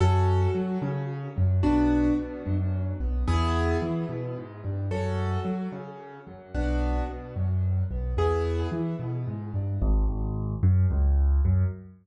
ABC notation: X:1
M:3/4
L:1/8
Q:1/4=110
K:A
V:1 name="Acoustic Grand Piano"
[CFA]2 F C2 F, | [B,DF]2 B, F,2 B, | [B,EG]2 E B, G, =G, | [CFA]2 F C2 F, |
[B,DF]2 B, F,2 B, | [B,EG]2 E B, G, =G, | [K:F#m] z6 | z6 |]
V:2 name="Acoustic Grand Piano" clef=bass
F,,2 F, C,2 F,, | B,,,2 B,, F,,2 B,,, | E,,2 E, B,, G,, =G,, | F,,2 F, C,2 F,, |
B,,,2 B,, F,,2 B,,, | E,,2 E, B,, G,, =G,, | [K:F#m] G,,, G,,,2 F,, C,,2 | F,,2 z4 |]